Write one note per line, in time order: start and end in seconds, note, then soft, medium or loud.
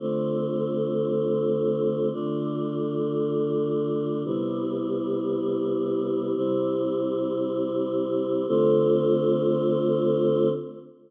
0.00 2.09 D3 medium
0.00 2.09 A3 medium
0.00 2.09 C4 medium
0.00 2.09 F4 medium
2.13 4.23 D3 medium
2.13 4.23 A3 medium
2.13 4.23 D4 medium
2.13 4.23 F4 medium
4.25 6.35 C3 medium
4.25 6.35 G3 medium
4.25 6.35 B3 medium
4.25 6.35 E4 medium
6.36 8.46 C3 medium
6.36 8.46 G3 medium
6.36 8.46 C4 medium
6.36 8.46 E4 medium
8.48 10.49 D3 loud
8.48 10.49 A3 medium
8.48 10.49 C4 loud
8.48 10.49 F4 loud